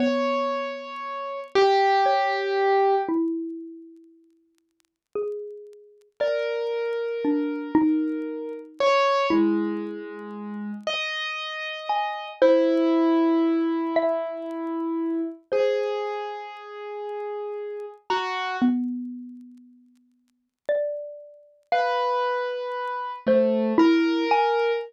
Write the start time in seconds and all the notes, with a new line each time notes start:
0.00 B3 C#5
1.55 G4
2.06 C#5
3.09 E4
5.16 G#4
6.20 A#4 D5
7.25 D4
7.75 D#4
8.80 C#5
9.30 G#3 E4
10.87 D#5
11.89 G#5
12.42 E4 C5
13.96 E5
15.52 G#4 C5
18.10 F#4 A#5
18.62 B3
20.69 D5
21.72 B4 F5
23.27 A3 C5
23.78 E4 A#4
24.31 G#5